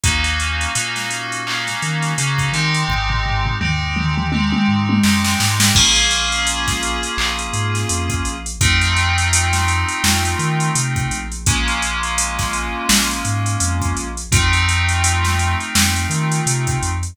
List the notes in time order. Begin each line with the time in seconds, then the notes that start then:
0.03 D#2 A#3 C#4 D#4 F#4, kick, closed hi-hat
0.24 closed hi-hat
0.40 closed hi-hat
0.61 closed hi-hat
0.75 A#2 A#3 C#4 D#4 F#4, closed hi-hat
0.96 snare, closed hi-hat
1.10 closed hi-hat
1.32 closed hi-hat
1.47 A#3 C#4 D#4 F#4, clap
1.67 snare, closed hi-hat
1.82 D#3, closed hi-hat
2.02 snare, closed hi-hat
2.18 C#3 A#3 C#4 D#4 F#4, closed hi-hat
2.38 kick, closed hi-hat
2.52 D#3 G#3 C4 D#4 G4, closed hi-hat
2.74 closed hi-hat
2.88 G#1, kick, floor tom
3.10 floor tom
3.26 floor tom
3.46 floor tom
3.60 D#2 G#3 C4 D#4 G4, mid tom
3.96 mid tom
4.18 mid tom
4.32 G#3 C4 D#4 G4, high tom
4.52 high tom
4.68 G#2
4.89 high tom
5.03 F#2 G#3 C4 D#4 G4, snare
5.24 snare
5.40 G#2, snare
5.60 snare
5.75 A#1 A#3 C#4 F4 G#4, kick, crash
5.96 closed hi-hat
6.11 closed hi-hat
6.32 closed hi-hat
6.47 closed hi-hat
6.68 kick, snare, closed hi-hat
6.83 closed hi-hat
7.03 closed hi-hat
7.17 A#1, clap
7.39 closed hi-hat
7.53 G#2, closed hi-hat
7.75 snare, closed hi-hat
7.89 F2, closed hi-hat
8.10 kick, closed hi-hat
8.25 A#1, closed hi-hat
8.46 closed hi-hat
8.61 F2 A3 C4 D#4 F4, kick, closed hi-hat
8.81 closed hi-hat
8.96 closed hi-hat
9.18 closed hi-hat
9.33 closed hi-hat
9.53 snare, closed hi-hat
9.68 closed hi-hat
9.89 closed hi-hat
10.04 F2, snare
10.25 closed hi-hat
10.39 D#3, closed hi-hat
10.60 closed hi-hat
10.75 C3, closed hi-hat
10.96 kick, closed hi-hat
11.11 A#1, closed hi-hat
11.32 closed hi-hat
11.46 G#3 A#3 C#4 F4, kick, closed hi-hat
11.68 closed hi-hat
11.82 closed hi-hat
12.03 closed hi-hat
12.18 closed hi-hat
12.39 kick, snare, closed hi-hat
12.53 closed hi-hat
12.89 A#1, snare
13.11 closed hi-hat
13.25 G#2, closed hi-hat
13.46 closed hi-hat
13.60 F2, closed hi-hat
13.82 kick, closed hi-hat
13.96 A#1, closed hi-hat
14.17 closed hi-hat
14.31 F2 A3 C4 D#4 F4, kick, closed hi-hat
14.53 closed hi-hat
14.69 closed hi-hat
14.89 closed hi-hat
15.04 closed hi-hat
15.25 snare, closed hi-hat
15.39 closed hi-hat
15.60 closed hi-hat
15.75 F2, snare
15.96 closed hi-hat
16.10 D#3, closed hi-hat
16.32 closed hi-hat
16.46 C3, closed hi-hat
16.67 kick, closed hi-hat
16.82 F2, closed hi-hat
17.03 closed hi-hat